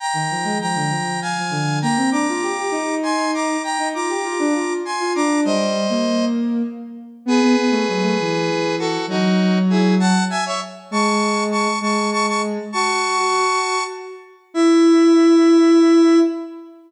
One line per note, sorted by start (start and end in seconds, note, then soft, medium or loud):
0.00 0.58 G5 medium
0.00 0.58 A#5 loud
0.14 0.28 D#3 medium
0.31 0.45 F3 medium
0.44 0.58 G#3 medium
0.61 0.77 F3 medium
0.61 1.20 G5 medium
0.61 1.20 A#5 loud
0.75 0.90 D3 medium
0.91 1.18 F3 medium
1.22 1.79 F5 medium
1.22 1.79 G#5 loud
1.38 1.53 F3 medium
1.50 1.79 D3 medium
1.82 1.97 A#3 medium
1.82 2.10 G5 medium
1.82 2.10 A#5 loud
1.97 2.11 C4 medium
2.11 2.26 D4 medium
2.11 2.95 A#5 medium
2.11 2.95 D6 medium
2.29 2.43 F4 medium
2.43 2.57 G4 medium
2.58 2.72 G4 medium
2.71 3.57 D#4 medium
3.03 3.31 G#5 medium
3.03 3.31 C6 loud
3.34 3.62 A#5 medium
3.34 3.62 D6 medium
3.64 3.88 G5 medium
3.64 3.88 A#5 loud
3.78 3.93 D#4 medium
3.94 4.09 F4 medium
3.94 4.73 A#5 medium
3.94 4.73 D6 medium
4.09 4.24 G4 medium
4.24 4.38 F4 medium
4.39 4.54 D4 medium
4.55 4.80 F4 medium
4.85 5.13 G#5 medium
4.85 5.13 C6 medium
5.00 5.14 F4 medium
5.15 5.44 D4 medium
5.15 5.40 A#5 medium
5.15 5.40 D6 loud
5.45 5.86 G3 medium
5.45 6.25 C5 medium
5.45 6.25 D#5 loud
5.89 6.62 A#3 medium
7.26 7.40 B3 medium
7.26 8.76 G#4 loud
7.26 8.76 B4 loud
7.42 7.56 B3 medium
7.56 7.70 B3 medium
7.71 7.85 A3 medium
7.88 8.03 F#3 medium
8.03 8.17 A3 medium
8.20 8.98 E3 medium
8.79 9.06 F#4 loud
8.79 9.06 A4 loud
9.08 10.13 F#3 medium
9.08 9.58 D#4 loud
9.08 9.58 F#4 loud
9.70 9.95 E4 medium
9.70 9.95 G#4 medium
10.00 10.24 F#5 loud
10.00 10.24 A5 loud
10.30 10.44 E5 loud
10.30 10.44 G#5 loud
10.46 10.60 C#5 medium
10.46 10.60 E5 loud
10.91 11.67 G#3 medium
10.91 11.44 A5 medium
10.91 11.44 C#6 loud
11.51 11.79 A5 medium
11.51 11.79 C#6 medium
11.81 12.58 G#3 medium
11.81 12.10 A5 medium
11.81 12.10 C#6 medium
12.12 12.26 A5 loud
12.12 12.26 C#6 loud
12.27 12.42 A5 medium
12.27 12.42 C#6 loud
12.72 13.17 F#4 medium
12.72 13.83 A5 loud
12.72 13.83 C#6 loud
13.18 13.79 F#4 medium
14.54 16.19 E4 loud
14.54 16.19 E5 loud